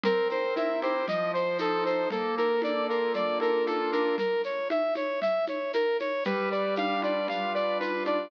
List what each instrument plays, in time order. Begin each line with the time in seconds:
0.03 acoustic grand piano C4, brass section A#4, low conga, shaker
0.29 acoustic grand piano A#4, brass section C5, high conga, shaker
0.56 acoustic grand piano E4, brass section E5, high conga, shaker
0.82 acoustic grand piano G4, brass section C5, high conga, shaker
1.07 acoustic grand piano F3, brass section D#5, low conga, shaker
1.34 acoustic grand piano C5, brass section C5, shaker
1.58 acoustic grand piano D#4, brass section A4, high conga, shaker
1.84 acoustic grand piano A4, brass section C5, high conga, shaker
2.10 acoustic grand piano A#3, brass section A4, low conga, shaker
2.37 acoustic grand piano A4, brass section A#4, high conga, shaker
2.62 acoustic grand piano D4, brass section D5, high conga, shaker
2.89 acoustic grand piano F4, brass section A#4, shaker
3.13 acoustic grand piano A#3, brass section D5, low conga, shaker
3.40 acoustic grand piano A4, brass section A#4, high conga, shaker
3.66 acoustic grand piano F4, brass section A4, high conga, shaker
3.92 acoustic grand piano D4, brass section A#4, high conga, shaker
4.18 brass section A#4, low conga, shaker
4.43 brass section C#5, shaker
4.70 brass section E5, high conga, shaker
4.94 brass section C#5, high conga, shaker
5.21 brass section E5, low conga, shaker
5.47 brass section C#5, high conga, shaker
5.73 brass section A#4, high conga, shaker
5.99 brass section C#5, high conga, shaker
6.24 acoustic grand piano G3, brass section B4, low conga, shaker
6.51 acoustic grand piano B4, brass section D5, shaker
6.76 acoustic grand piano D4, brass section F5, high conga, shaker
7.02 acoustic grand piano F4, brass section D5, high conga, shaker
7.28 acoustic grand piano G3, brass section F5, low conga, shaker
7.54 acoustic grand piano B4, brass section D5, shaker
7.80 acoustic grand piano F4, brass section B4, high conga, shaker
8.05 acoustic grand piano D4, brass section D5, high conga, shaker